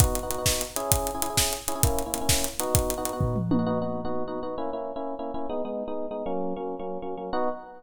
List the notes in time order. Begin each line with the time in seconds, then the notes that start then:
0.00 B3 D#4 F#4, kick, closed hi-hat
0.15 closed hi-hat
0.23 B3 D#4 F#4
0.30 B3 D#4 F#4, closed hi-hat
0.38 B3 D#4 F#4
0.46 kick, snare
0.61 closed hi-hat
0.76 C#4 E4 G#4, closed hi-hat
0.92 kick, closed hi-hat
1.07 closed hi-hat
1.15 C#4 E4 G#4
1.22 C#4 E4 G#4, closed hi-hat
1.30 C#4 E4 G#4
1.37 kick, snare
1.53 closed hi-hat
1.68 C#4 E4 G#4, closed hi-hat
1.75 C#4 E4 G#4
1.83 A#3 C#4 E4, kick, closed hi-hat
1.99 closed hi-hat
2.06 A#3 C#4 E4
2.14 A#3 C#4 E4, closed hi-hat
2.21 A#3 C#4 E4
2.29 kick, snare
2.44 closed hi-hat
2.59 B3 D#4 F#4, closed hi-hat
2.75 kick, closed hi-hat
2.90 closed hi-hat
2.98 B3 D#4 F#4
3.05 B3 D#4 F#4, closed hi-hat
3.13 B3 D#4 F#4
3.21 kick, floor tom
3.36 mid tom
3.51 B3 D#4 F#4, high tom
3.59 B3 D#4 F#4
3.66 B3 D#4 F#4
3.82 B3 D#4 F#4
4.05 B3 D#4 F#4
4.28 B3 D#4 F#4
4.43 B3 D#4 F#4
4.58 A#3 C#4 E4
4.73 A#3 C#4 E4
4.96 A#3 C#4 E4
5.19 A#3 C#4 E4
5.34 A#3 C#4 E4
5.49 G#3 B3 D#4
5.65 G#3 B3 D#4
5.88 G#3 B3 D#4
6.11 G#3 B3 D#4
6.26 F#3 A#3 C#4
6.56 F#3 A#3 C#4
6.79 F#3 A#3 C#4
7.02 F#3 A#3 C#4
7.17 F#3 A#3 C#4
7.33 B3 D#4 F#4